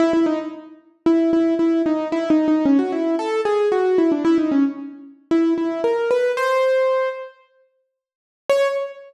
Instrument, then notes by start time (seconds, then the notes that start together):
acoustic grand piano
0.00 E4
0.13 E4
0.26 D#4
1.06 E4
1.33 E4
1.59 E4
1.86 D#4
2.12 E4
2.30 D#4
2.48 D#4
2.65 C#4
2.79 F#4
2.92 E4
3.19 A4
3.45 G#4
3.72 F#4
3.98 E4
4.12 D4
4.25 E4
4.38 D#4
4.52 C#4
5.31 E4
5.58 E4
5.84 A#4
6.11 B4
6.37 C5
8.49 C#5